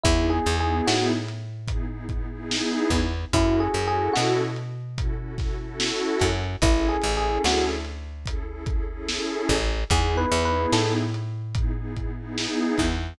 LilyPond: <<
  \new Staff \with { instrumentName = "Electric Piano 1" } { \time 4/4 \key fis \minor \tempo 4 = 73 \tuplet 3/2 { e'8 gis'8 gis'8 } fis'16 r2 r8. | \tuplet 3/2 { e'8 gis'8 gis'8 } fis'16 r2 r8. | \tuplet 3/2 { e'8 gis'8 gis'8 } fis'16 r2 r8. | \tuplet 3/2 { gis'8 b'8 b'8 } a'16 r2 r8. | }
  \new Staff \with { instrumentName = "Pad 2 (warm)" } { \time 4/4 \key fis \minor <b dis' e' gis'>8 <b dis' e' gis'>4. <b dis' e' gis'>16 <b dis' e' gis'>16 <b dis' e' gis'>16 <b dis' e' gis'>4~ <b dis' e' gis'>16 | <cis' e' fis' a'>8 <cis' e' fis' a'>4. <cis' e' fis' a'>16 <cis' e' fis' a'>16 <cis' e' fis' a'>16 <cis' e' fis' a'>4~ <cis' e' fis' a'>16 | <cis' e' gis' a'>8 <cis' e' gis' a'>4. <cis' e' gis' a'>16 <cis' e' gis' a'>16 <cis' e' gis' a'>16 <cis' e' gis' a'>4~ <cis' e' gis' a'>16 | <b dis' e' gis'>8 <b dis' e' gis'>4. <b dis' e' gis'>16 <b dis' e' gis'>16 <b dis' e' gis'>16 <b dis' e' gis'>4~ <b dis' e' gis'>16 | }
  \new Staff \with { instrumentName = "Electric Bass (finger)" } { \clef bass \time 4/4 \key fis \minor e,8 e,8 a,2~ a,8 e,8 | fis,8 fis,8 b,2~ b,8 fis,8 | a,,8 a,,8 d,2~ d,8 a,,8 | e,8 e,8 a,2~ a,8 e,8 | }
  \new DrumStaff \with { instrumentName = "Drums" } \drummode { \time 4/4 <hh bd>8 hh8 sn8 hh8 <hh bd>8 <hh bd>8 sn8 <hh bd sn>8 | <hh bd>8 hh8 sn8 hh8 <hh bd>8 <hh bd sn>8 sn8 <hh bd sn>8 | <hh bd>8 hh8 sn8 hh8 <hh bd>8 <hh bd>8 sn8 <hh bd sn>8 | <hh bd>8 hh8 sn8 hh8 <hh bd>8 <hh bd>8 sn8 <hh bd sn>8 | }
>>